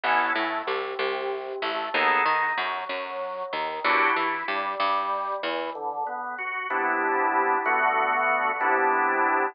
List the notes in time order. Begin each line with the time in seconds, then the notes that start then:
0.04 A1 B3 C#4 E4 A4
0.35 A2 A3
0.67 C2 C3
0.99 C2 C3
1.62 A1 A3
1.94 D#2 B3 D#4 G#4 A4
2.26 D#3 D#4
2.58 F#2 F#3
2.89 F#2 F#3
3.53 D#2 D#3
3.84 E2 D4 E4 F#4 G4
4.16 E3 E4
4.48 G2 G3
4.80 G2 G3
5.43 E2 E3
5.75 D3
6.07 B3
6.38 F#4
6.70 C3 B3 D4 E4
7.66 D3 A3 B3 F#4
8.61 C3 B3 D4 E4